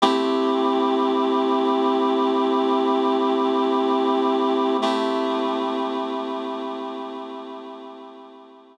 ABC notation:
X:1
M:4/4
L:1/8
Q:1/4=50
K:Ador
V:1 name="Clarinet"
[A,CEG]8 | [A,CEG]8 |]